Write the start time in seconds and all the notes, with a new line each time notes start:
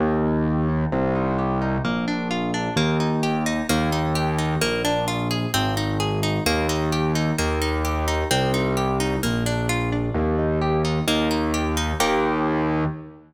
0.00 D#2 A#3
0.23 D#4
0.46 G4
0.69 D#4
0.92 C2 C4
1.15 D#4
1.39 G4
1.62 D#4
1.84 A#1 A#3
2.08 D4
2.31 F4
2.54 D4
2.76 D#2 A#3
3.00 D#4
3.23 G4
3.46 D#4
3.69 D#2 A#3
3.92 D#4
4.15 G4
4.38 D#4
4.61 A#1 A#3
4.85 D4
5.08 F4
5.31 G#4
5.54 G#1 C4
5.77 D#4
6.00 G#4
6.23 D#4
6.46 D#2 A#3
6.69 D#4
6.92 G4
7.15 D#4
7.38 D#2 A#3
7.62 D#4
7.85 G4
8.08 D#4
8.31 C2 C4
8.54 D#4
8.77 G4
9.00 D#4
9.23 A#1 A#3
9.46 D4
9.69 F4
9.92 D4
10.15 D#2 A#3
10.39 D#4
10.62 G4
10.85 D#4
11.08 D#2 A#3
11.31 D#4
11.54 G4
11.77 D#4
12.00 D#2 A#3 D#4 G4